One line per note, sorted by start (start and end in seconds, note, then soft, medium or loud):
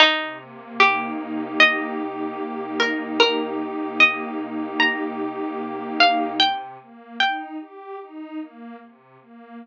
0.00 1.58 C3 loud
0.00 0.39 D#4 medium
0.40 1.99 A#3 loud
0.80 2.40 D#4 medium
0.80 1.51 G4 medium
1.20 2.81 G4 loud
1.58 3.19 C3 medium
1.58 2.76 D#5 medium
2.00 3.58 A#3 medium
2.41 3.99 D#4 medium
2.80 4.38 G4 medium
2.80 3.19 A#4 medium
3.20 4.79 C3 loud
3.20 3.59 A#4 loud
3.59 5.19 A#3 medium
4.00 5.60 D#4 medium
4.00 4.75 D#5 medium
4.38 6.31 G4 loud
4.80 5.99 C3 loud
4.80 5.86 A#5 medium
5.19 6.34 A#3 medium
5.60 6.37 D#4 medium
6.00 6.77 C3 loud
6.00 6.39 F5 medium
6.40 7.15 G5 loud
6.80 7.17 A#3 medium
7.19 7.56 D#4 medium
7.19 7.97 G5 medium
7.60 7.97 G4 medium
8.01 8.38 D#4 loud
8.39 8.76 A#3 loud
8.80 9.17 C3 medium
9.20 9.57 A#3 medium